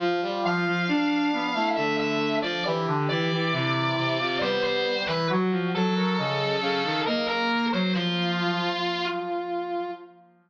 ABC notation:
X:1
M:3/4
L:1/16
Q:1/4=68
K:Ddor
V:1 name="Brass Section"
z2 f6 e e2 d | z2 d6 c c2 B | z2 A6 _B B2 c | F6 z6 |]
V:2 name="Brass Section"
F4 D3 E A,3 z | G4 E3 F B,3 z | _G2 A _B _e2 f2 e z2 _d | F10 z2 |]
V:3 name="Brass Section"
F, G, F, F, D2 B, A, D,3 F, | E, D, E, E, C,2 C, C, G,3 E, | _G, F, G, G, _D,2 D, _E, _B,3 G, | F,4 z8 |]